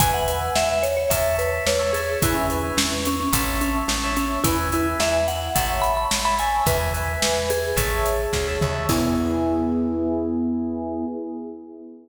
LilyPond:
<<
  \new Staff \with { instrumentName = "Vibraphone" } { \time 4/4 \key e \major \tempo 4 = 108 gis''16 fis''8. e''16 e''16 cis''16 cis''16 e''8 b'8 cis''8 gis'8 | e'16 cis'8. cis'16 cis'16 cis'16 cis'16 cis'8 cis'8 cis'8 cis'8 | e'16 r16 e'16 r16 e''8 fis''8 fis''16 r16 b''16 b''16 r16 b''16 gis''8 | b'4. gis'2 r8 |
e'1 | }
  \new Staff \with { instrumentName = "Electric Piano 1" } { \time 4/4 \key e \major <b' e'' gis''>8 <b' e'' gis''>4. <cis'' e'' a''>4~ <cis'' e'' a''>16 <cis'' e'' a''>16 <cis'' e'' a''>8 | <b' e'' gis''>8 <b' e'' gis''>4. <cis'' e'' a''>4~ <cis'' e'' a''>16 <cis'' e'' a''>16 <cis'' e'' a''>8 | <b' e'' gis''>8 <b' e'' gis''>4. <cis'' e'' a''>4~ <cis'' e'' a''>16 <cis'' e'' a''>16 <cis'' e'' a''>8 | <b' e'' gis''>8 <b' e'' gis''>4. <cis'' e'' a''>4~ <cis'' e'' a''>16 <cis'' e'' a''>16 <cis'' e'' a''>8 |
<b e' gis'>1 | }
  \new Staff \with { instrumentName = "Electric Bass (finger)" } { \clef bass \time 4/4 \key e \major e,4 e,4 e,4 e,4 | e,4 e,4 a,,4 a,,4 | e,4 e,4 a,,4 a,,4 | e,4 e,4 a,,4 d,8 dis,8 |
e,1 | }
  \new DrumStaff \with { instrumentName = "Drums" } \drummode { \time 4/4 <hh bd>8 hh8 sn8 hh8 <hh bd>8 hh8 sn8 hh8 | <hh bd>8 hh8 sn8 hh8 <hh bd>8 hh8 sn8 hh8 | <hh bd>8 hh8 sn8 hh8 <hh bd>8 hh8 sn8 hh8 | <hh bd>8 hh8 sn8 hh8 <hh bd>8 hh8 <bd sn>8 toml8 |
<cymc bd>4 r4 r4 r4 | }
>>